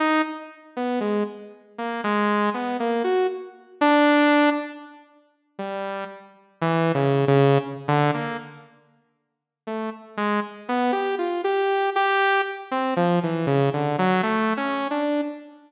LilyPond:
\new Staff { \time 5/8 \tempo 4 = 59 ees'16 r8 b16 aes16 r8 bes16 aes8 | b16 bes16 ges'16 r8 d'8. r8 | r8 g8 r8 \tuplet 3/2 { e8 des8 des8 } | r16 d16 bes16 r4 r16 a16 r16 |
aes16 r16 b16 g'16 f'16 g'8 g'8 r16 | c'16 f16 e16 des16 d16 ges16 \tuplet 3/2 { a8 des'8 d'8 } | }